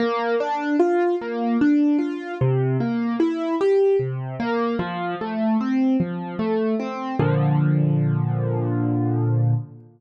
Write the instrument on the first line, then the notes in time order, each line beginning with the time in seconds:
acoustic grand piano
0.00 A#3
0.40 D4
0.80 F4
1.22 A#3
1.61 D4
1.99 F4
2.41 C3
2.80 A#3
3.20 E4
3.61 G4
4.00 C3
4.40 A#3
4.79 F3
5.21 A3
5.61 C4
6.00 F3
6.39 A3
6.80 C4
7.20 A#2 D3 F3